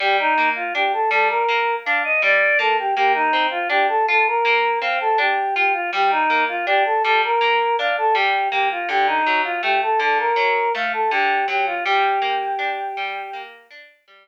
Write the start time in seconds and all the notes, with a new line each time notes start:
0.00 G3 G4
0.19 D#4
0.38 A#3
0.56 F4
0.75 D4 G4
0.93 A4
1.10 G3 A4
1.29 A#4
1.48 A#3
1.85 D4 F5
2.04 D#5
2.22 G3 D5
2.59 A#3 A4
2.79 G4
2.95 A#3 G4
3.14 D#4
3.33 C4
3.51 F4
3.69 D4 G4
3.88 A4
4.08 F4 A4
4.27 A#4
4.45 A#3
4.81 C4 F5
5.01 A4
5.18 D4 G4
5.56 F4 G4
5.73 F4
5.93 G3 G4
6.11 D#4
6.30 A#3
6.48 F4
6.66 D4 G4
6.85 A4
7.04 G3 A4
7.24 A#4
7.41 A#3
7.79 D4 F5
7.98 A4
8.14 G3 G4
8.51 A#3 G4
8.71 F4
8.88 D3 G4
9.07 D#4
9.26 F#3
9.44 F4
9.63 A3 G4
9.82 A4
9.99 D3 A4
10.19 A#4
10.36 F#3
10.75 A3 F5
10.93 A4
11.11 D3 G4
11.48 F#3 G4
11.66 F4
11.85 G3 G4
12.22 A#3
12.59 D4
12.97 G3
13.33 A#3
13.70 D4
14.08 G3